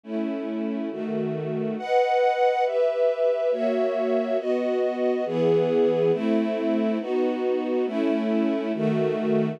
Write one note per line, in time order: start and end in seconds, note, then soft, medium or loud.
0.04 0.90 A3 medium
0.04 0.90 C#4 medium
0.04 0.90 E4 medium
0.91 1.77 D#3 medium
0.91 1.77 A3 medium
0.91 1.77 F#4 medium
1.78 2.64 B4 medium
1.78 2.64 D#5 medium
1.78 2.64 F#5 medium
2.65 3.51 G4 medium
2.65 3.51 B4 medium
2.65 3.51 E5 medium
3.51 4.38 A#3 medium
3.51 4.38 F#4 medium
3.51 4.38 C#5 medium
3.51 4.38 E5 medium
4.39 5.25 B3 medium
4.39 5.25 F#4 medium
4.39 5.25 D#5 medium
5.25 6.11 E3 loud
5.25 6.11 B3 medium
5.25 6.11 G#4 loud
6.12 6.98 A3 loud
6.12 6.98 C4 medium
6.12 6.98 E4 loud
7.00 7.86 B3 medium
7.00 7.86 D#4 medium
7.00 7.86 F#4 medium
7.86 8.72 A3 loud
7.86 8.72 C#4 medium
7.86 8.72 E4 loud
8.74 9.60 D#3 medium
8.74 9.60 A3 loud
8.74 9.60 F#4 medium